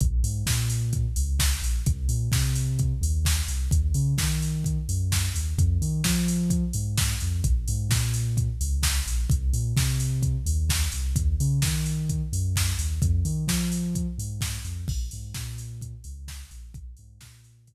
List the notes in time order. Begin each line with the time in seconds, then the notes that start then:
0.00 A#1, kick, closed hi-hat
0.23 G#2, open hi-hat
0.46 A#2, kick, snare
0.70 open hi-hat
0.93 kick, closed hi-hat
1.16 C#2, open hi-hat
1.39 kick, snare
1.62 A#1, open hi-hat
1.86 C2, kick, closed hi-hat
2.09 A#2, open hi-hat
2.32 C3, kick, snare
2.55 open hi-hat
2.79 kick, closed hi-hat
3.01 D#2, open hi-hat
3.25 kick, snare
3.48 C2, open hi-hat
3.71 D#2, kick, closed hi-hat
3.94 C#3, open hi-hat
4.18 D#3, kick, snare
4.42 open hi-hat
4.64 kick, closed hi-hat
4.89 F#2, open hi-hat
5.12 kick, snare
5.34 D#2, open hi-hat
5.58 F2, kick, closed hi-hat
5.81 D#3, open hi-hat
6.04 F3, kick, snare
6.28 open hi-hat
6.50 kick, closed hi-hat
6.73 G#2, open hi-hat
6.97 kick, snare
7.20 F2, open hi-hat
7.44 A#1, kick, closed hi-hat
7.68 G#2, open hi-hat
7.89 A#2, kick, snare
8.14 open hi-hat
8.37 kick, closed hi-hat
8.61 C#2, open hi-hat
8.83 kick, snare
9.06 A#1, open hi-hat
9.30 C2, kick, closed hi-hat
9.53 A#2, open hi-hat
9.77 C3, kick, snare
10.00 open hi-hat
10.23 kick, closed hi-hat
10.46 D#2, open hi-hat
10.69 kick, snare
10.92 C2, open hi-hat
11.16 D#2, kick, closed hi-hat
11.40 C#3, open hi-hat
11.62 D#3, kick, snare
11.86 open hi-hat
12.09 kick, closed hi-hat
12.33 F#2, open hi-hat
12.56 kick, snare
12.79 D#2, open hi-hat
13.02 F2, kick, closed hi-hat
13.25 D#3, open hi-hat
13.47 F3, kick, snare
13.72 open hi-hat
13.95 kick, closed hi-hat
14.18 G#2, open hi-hat
14.41 kick, snare
14.65 F2, open hi-hat
14.88 A#1, kick, crash
15.11 G#2, open hi-hat
15.34 A#2, kick, snare
15.58 open hi-hat
15.81 kick, closed hi-hat
16.04 C#2, open hi-hat
16.28 kick, snare
16.51 A#1, open hi-hat
16.74 A#1, kick, closed hi-hat
16.97 G#2, open hi-hat
17.21 A#2, kick, snare
17.44 open hi-hat
17.67 kick, closed hi-hat